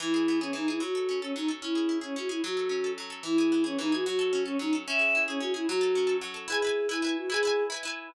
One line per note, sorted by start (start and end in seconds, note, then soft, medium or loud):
0.00 0.53 E3 loud
0.00 0.37 E4 loud
0.14 0.41 G#4 medium
0.28 0.80 B3 medium
0.40 0.52 C#4 medium
0.40 0.68 G#4 medium
0.53 0.79 E3 medium
0.53 0.68 D#4 medium
0.68 0.80 E4 medium
0.68 0.81 G#4 medium
0.80 1.35 F#3 medium
0.80 1.18 F#4 medium
0.95 1.22 A4 medium
1.09 1.60 C#4 medium
1.21 1.33 C#4 medium
1.21 1.48 A4 medium
1.35 1.61 F#3 medium
1.35 1.48 D#4 medium
1.48 1.61 A4 medium
1.62 2.16 C#4 medium
1.62 1.96 E4 medium
1.75 2.01 G#4 medium
1.89 2.40 E4 medium
2.01 2.15 C#4 medium
2.01 2.29 G#4 medium
2.16 2.42 C#4 medium
2.16 2.28 F#4 medium
2.29 2.40 E4 medium
2.29 2.42 G#4 medium
2.44 2.97 F#3 medium
2.44 2.90 F#4 medium
2.57 2.84 A4 medium
2.69 3.21 C#4 medium
2.84 3.10 A4 medium
2.98 3.23 F#3 medium
3.10 3.23 A4 medium
3.23 3.78 E3 medium
3.23 3.62 E4 loud
3.38 3.63 G#4 medium
3.52 4.03 B3 medium
3.64 3.77 C#4 medium
3.64 3.92 G#4 medium
3.79 4.04 E3 medium
3.79 3.92 D#4 medium
3.92 4.05 F#4 medium
3.92 4.05 G#4 medium
4.05 4.59 F#3 loud
4.05 4.42 F#4 medium
4.19 4.45 A4 medium
4.33 4.84 C#4 medium
4.45 4.57 C#4 medium
4.45 4.72 A4 medium
4.59 4.85 F#3 medium
4.59 4.73 D#4 medium
4.73 4.86 A4 medium
4.87 5.40 C#4 loud
4.87 5.21 E5 loud
4.99 5.27 G#4 medium
5.15 5.66 E4 medium
5.27 5.39 C#4 medium
5.27 5.54 G#4 medium
5.40 5.66 C#4 medium
5.40 5.52 F#4 medium
5.54 5.65 E4 medium
5.54 5.67 G#4 medium
5.68 6.21 F#3 loud
5.68 6.15 F#4 loud
5.81 6.06 A4 medium
5.95 6.47 C#4 medium
6.07 6.34 A4 medium
6.21 6.47 F#3 medium
6.34 6.47 A4 medium
6.48 6.60 E4 loud
6.48 6.87 G#4 medium
6.48 6.60 B4 loud
6.52 6.60 G#5 loud
6.62 6.87 E4 medium
6.62 6.87 B4 medium
6.67 6.87 G#5 loud
6.89 7.01 E4 loud
6.89 7.15 E4 medium
6.89 7.01 B4 medium
6.94 7.01 G#5 medium
7.02 7.27 E4 medium
7.02 7.27 B4 medium
7.07 7.27 G#5 loud
7.17 7.30 F#4 medium
7.30 7.42 E4 loud
7.30 7.63 G#4 medium
7.30 7.42 B4 loud
7.34 7.42 G#5 loud
7.43 7.68 E4 medium
7.43 7.68 B4 loud
7.47 7.68 G#5 loud
7.70 7.82 E4 medium
7.70 7.82 B4 medium
7.74 7.82 G#5 medium
7.83 8.08 E4 medium
7.83 8.08 B4 loud
7.88 8.08 G#5 medium